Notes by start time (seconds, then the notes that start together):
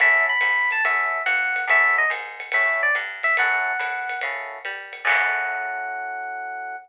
0.00 F#2 C#4 E4 F#4 A4 E5, kick, ride
0.29 B5
0.41 G#2, hi-hat pedal, ride
0.71 A5, ride
0.84 F#2 C#4 E4 F#4 A4 E5, kick, ride
1.26 F2 F#5, hi-hat pedal, ride
1.56 ride
1.67 F#2 C#4 E4 F#4 A4 E5, kick, ride
1.98 D#5
2.10 G#2, hi-hat pedal, ride
2.40 ride
2.52 A2 C#4 E4 F#4 A4 E5, kick, ride
2.83 D5
2.95 G2, hi-hat pedal, ride
3.23 E5, ride
3.37 F#2 C#4 E4 F#4 A4 F#5, kick, ride
3.79 A2, hi-hat pedal, ride
4.09 ride
4.21 C#3 C#4 E4 F#4 A4, kick, ride
4.65 G3, hi-hat pedal, ride
4.93 ride
5.05 F#2 C#4 E4 F#4 A4 F#5, kick, crash